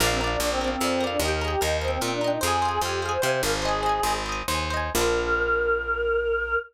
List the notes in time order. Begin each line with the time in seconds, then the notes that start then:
0.00 A#1 D4 A#4 D5
0.07 C4 F5
0.20 D4 A#4 D5
0.27 D4 F5
0.40 A#1 D4 A#4 D5
0.47 C4 F5
0.61 C4 A#4 D5
0.68 C4 F5
0.80 F2 A#4 D5
0.87 F5
1.00 A#4 D5
1.07 F5
1.11 D4
1.19 D#2 G4 A#4
1.25 D#5 G5
1.31 A#4
1.41 G#4 A#4 D#5
1.48 G4 G5
1.61 D#2 D#4 A#4 D#5
1.68 G5
1.81 C4 A#4 D#5
1.88 C4 G5
2.01 A#2 C4 A#4 D#5
2.08 D4 G5
2.21 D4 A#4 D#5
2.28 D#4 G5
2.41 F2 G#4 C5 F5
2.47 G#5
2.62 C5 F5
2.69 G#5
2.81 F2 G4 C5 F5
2.89 G#5
3.02 G#4 C5 F5
3.09 C5 G#5
3.22 C3 C5 F5
3.29 C5 G#5
3.42 G#1 A#4 C5 F5
3.49 G#5
3.62 G#4 C5 D#5
3.68 G#5
3.83 C5 D#5
3.89 G#5
4.03 G#1 C5 D#5
4.10 G#5
4.26 C5 D#5
4.32 G#5
4.48 D#2 C5 D#5
4.55 G#5
4.70 C5 D#5
4.77 G#5
4.95 A#1 A#3 D4 A#4
5.01 F4